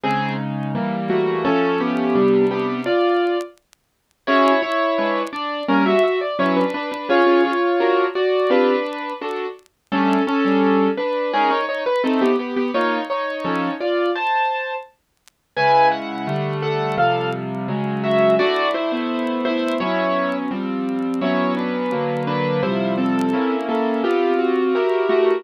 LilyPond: <<
  \new Staff \with { instrumentName = "Acoustic Grand Piano" } { \time 2/2 \key c \lydian \tempo 2 = 85 <c' aes'>4 r2 <a fis'>4 | <cis' a'>4 <b g'>2 <b g'>4 | <f' d''>4. r2 r8 | \key g \lydian <e' cis''>4 <e' cis''>2 <d' d''>4 |
<des' bes'>8 <fis' e''>8 <fis' e''>8 d''8 <e' cis''>8 <d' b'>8 <d' b'>8 <d' b'>8 | <eis' cis''>4 <eis' cis''>2 <fis' d''>4 | <d' b'>2 r2 | <cis' a'>4 <cis' a'>2 <d' b'>4 |
<cis' aes'>8 <ees' cis''>8 <ees' cis''>8 b'8 <c' a'>8 <b g'>8 <b g'>8 <b g'>8 | <ees' cis''>4 <ees' cis''>2 <f' d''>4 | <c'' a''>2 r2 | \key c \lydian <b' aes''>4 fis''2 <a' fis''>4 |
<a' f''>4 r2 <ges' e''>4 | <fis' d''>4 <e' c''>2 <e' c''>4 | <e' cis''>2 r2 | <e' cis''>4 <d' b'>2 <d' b'>4 |
<e' c''>4 <c' a'>2 <bes a'>4 | <b g'>4 fis'2 <a fis'>4 | }
  \new Staff \with { instrumentName = "Acoustic Grand Piano" } { \time 2/2 \key c \lydian <des aes ees'>2 <e g bes>2 | <f a cis'>2 <c g d'>2 | r1 | \key g \lydian <cis' fis' gis'>2 <aes d' ces''>2 |
<g bes des'>2 <fis cis' b'>2 | <cis' gis'>8 <cis' eis' gis'>4. <d' fis' ais'>2 | <c' f' g'>2 <d' fis' a'>2 | <g a d'>4. <g d' a'>2~ <g d' a'>8 |
<aes ees' bes'>2 <a ees' c''>2 | <bes f'>2 <f cis' a'>2 | r1 | \key c \lydian <des aes fes'>2 <d g a>2 |
<c f g>2 <des ges aes>2 | <a d' e'>4. <a b e'>2~ <a b e'>8 | <fis b cis'>2 <f g c'>2 | <fis b cis'>2 <d fis ais>2 |
<c f g>2 <bes des' fes'>2 | <c' f' g'>2 <e' g' bes'>2 | }
>>